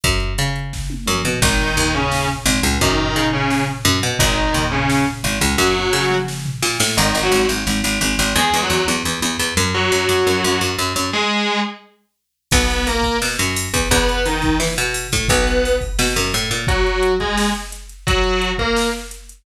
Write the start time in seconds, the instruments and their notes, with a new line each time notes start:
0.04 electric bass (finger) F#2, kick, closed hi-hat
0.20 closed hi-hat
0.38 electric bass (finger) C#3, closed hi-hat
0.56 closed hi-hat
0.73 kick, snare
0.90 high tom
1.06 electric bass (finger) F#2, mid tom
1.25 electric bass (finger) B2, floor tom
1.42 electric bass (finger) G#1, distortion guitar D#3 D#4, kick, crash
1.59 floor tom
1.77 electric bass (finger) D#2, floor tom
1.94 distortion guitar C#3 C#4, floor tom
2.11 snare
2.29 floor tom
2.46 electric bass (finger) G#1, floor tom
2.62 electric bass (finger) C#2, floor tom
2.81 electric bass (finger) F#2, distortion guitar D#3 D#4, kick, floor tom
2.98 floor tom
3.15 electric bass (finger) C#3, floor tom
3.32 distortion guitar C#3 C#4, floor tom
3.50 snare
3.67 floor tom
3.85 electric bass (finger) F#2, floor tom
4.02 electric bass (finger) B2, floor tom
4.19 electric bass (finger) G#1, distortion guitar D#3 D#4, kick, floor tom
4.37 floor tom
4.54 electric bass (finger) D#2, floor tom
4.71 distortion guitar C#3 C#4, floor tom
4.89 snare
5.07 floor tom
5.23 electric bass (finger) G#1, floor tom
5.41 electric bass (finger) C#2, floor tom
5.58 electric bass (finger) F#2, distortion guitar F#3 F#4, kick, snare
5.75 high tom
5.93 electric bass (finger) C#3, snare
6.10 mid tom
6.28 snare
6.46 floor tom
6.62 electric bass (finger) A#2, snare
6.80 electric bass (finger) A2, snare
6.97 electric bass (finger) G#1, distortion guitar D#3 D#4
7.15 electric bass (finger) G#1
7.23 distortion guitar F#3 F#4
7.32 electric bass (finger) G#1
7.49 electric bass (finger) G#1
7.67 electric bass (finger) G#1
7.84 electric bass (finger) G#1
8.01 electric bass (finger) G#1
8.19 electric bass (finger) G#1
8.36 electric bass (finger) E2, distortion guitar G#3 G#4
8.54 electric bass (finger) E2
8.62 distortion guitar F#3 F#4
8.70 electric bass (finger) E2
8.88 electric bass (finger) E2
9.05 electric bass (finger) E2
9.22 electric bass (finger) E2
9.39 electric bass (finger) E2
9.57 electric bass (finger) F#2
9.74 distortion guitar F#3 F#4
9.92 electric bass (finger) F#2
10.09 electric bass (finger) F#2
10.27 electric bass (finger) F#2
10.44 electric bass (finger) F#2
10.61 electric bass (finger) F#2
10.78 electric bass (finger) F#2
10.96 electric bass (finger) F#2
11.13 distortion guitar G#3 G#4
12.51 electric bass (finger) B1, distortion guitar B3 B4, kick, crash
12.70 ride
12.87 distortion guitar A#3 A#4, ride
13.03 kick, ride
13.22 electric bass (finger) B2, snare
13.39 electric bass (finger) F#2, ride
13.56 ride
13.73 electric bass (finger) E2, kick, ride
13.91 electric bass (finger) E2, distortion guitar B3 B4, kick, ride
14.09 ride
14.25 distortion guitar D#3 D#4, ride
14.42 kick, ride
14.60 electric bass (finger) E3, snare
14.78 electric bass (finger) B2, ride
14.94 ride
15.12 electric bass (finger) A2, kick, ride
15.28 electric bass (finger) B1, distortion guitar B3 B4, kick, ride
15.47 ride
15.65 ride
15.81 kick, ride
15.99 electric bass (finger) B2, snare
16.16 electric bass (finger) F#2, ride
16.34 electric bass (finger) A2, ride
16.51 electric bass (finger) A#2, ride
16.67 distortion guitar F#3 F#4, kick, closed hi-hat
16.87 closed hi-hat
17.03 closed hi-hat
17.20 distortion guitar G#3 G#4, kick, closed hi-hat
17.37 snare
17.55 closed hi-hat
17.72 closed hi-hat
17.89 closed hi-hat
18.07 distortion guitar F#3 F#4, kick, closed hi-hat
18.24 closed hi-hat
18.42 closed hi-hat
18.58 distortion guitar A#3 A#4, kick, closed hi-hat
18.76 snare
18.93 closed hi-hat
19.11 closed hi-hat
19.29 closed hi-hat